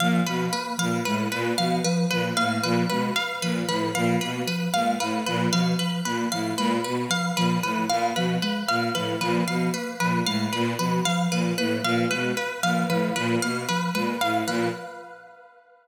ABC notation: X:1
M:4/4
L:1/8
Q:1/4=114
K:none
V:1 name="Violin" clef=bass
_B,, =B,, z _B,, A,, B,, =B,, z | _B,, A,, B,, =B,, z _B,, A,, B,, | B,, z _B,, A,, B,, =B,, z _B,, | A,, _B,, =B,, z _B,, A,, B,, =B,, |
z _B,, A,, B,, =B,, z _B,, A,, | _B,, =B,, z _B,, A,, B,, =B,, z | _B,, A,, B,, =B,, z _B,, A,, B,, |]
V:2 name="Ocarina"
F, F, _B, F, _A, z F, F, | F, _B, F, _A, z F, F, F, | _B, F, _A, z F, F, F, B, | F, _A, z F, F, F, _B, F, |
_A, z F, F, F, _B, F, A, | z F, F, F, _B, F, _A, z | F, F, F, _B, F, _A, z F, |]
V:3 name="Orchestral Harp"
f B B f B B f B | B f B B f B B f | B B f B B f B B | f B B f B B f B |
B f B B f B B f | B B f B B f B B | f B B f B B f B |]